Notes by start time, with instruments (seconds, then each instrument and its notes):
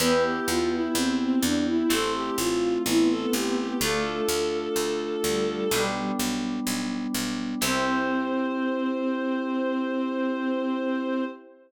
0.00 harpsichord E2, violin B3 B4, electric piano 2 B3 E4 G4
0.23 violin G4
0.48 harpsichord E2, violin F4
0.72 violin E4
0.95 harpsichord E2, violin C4
1.20 violin C4
1.42 harpsichord E2, violin D4
1.66 violin E4
1.89 harpsichord A1, electric piano 2 A3 C4 E4, violin A4
2.14 violin G4
2.38 harpsichord A1, violin F4
2.86 harpsichord A1, violin B3 E4
3.10 violin A4
3.33 harpsichord A1, violin G4
3.58 violin G4
3.79 harpsichord D2, violin A3 A4, electric piano 2 A3 D4 F4
4.29 harpsichord D2
4.76 harpsichord D2
5.24 harpsichord D2, violin G3
5.71 harpsichord B1, violin G3, electric piano 2 G3 B3 D4
6.19 harpsichord B1
6.67 harpsichord B1
7.14 harpsichord B1
7.61 harpsichord C2, electric piano 2 C4 E4 G4, violin C4 C5